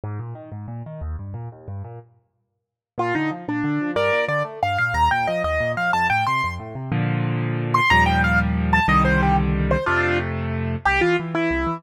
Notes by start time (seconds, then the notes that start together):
0.04 G#2
0.19 A#2
0.35 D#3
0.52 G#2
0.68 A#2
0.86 D#3
1.01 D#2
1.19 G2
1.34 A#2
1.52 D#2
1.68 G2
1.84 A#2
2.98 A#2 F4
3.15 D3 D#4
3.31 F3
3.48 A#2 D4
3.64 D3
3.81 F3
3.96 G2 A#4 D5
4.13 A#2
4.28 D3 D5
4.45 A3
4.63 G2 F5
4.78 A#2 F5
4.94 D#2 A#5
5.11 A#2 G5
5.27 F3 D#5
5.44 D#2 D#5
5.61 A#2
5.77 F3 F5
5.93 F2 A5
6.10 A2 G5
6.27 C3 C6
6.44 F2
6.59 A2
6.75 C3
6.92 A#2 D3 F3
7.74 C6
7.90 D#2 A#2 F3 G3 A#5
8.06 G5
8.24 F5
8.73 A5
8.88 C2 D3 D#3 G3 D#5
9.05 C5
9.23 G4
9.71 C5
9.86 F2 C3 A3 D4 F4
10.85 C2 G4
11.01 E3 F4
11.20 E3
11.35 E3 E4
11.51 C2
11.67 E3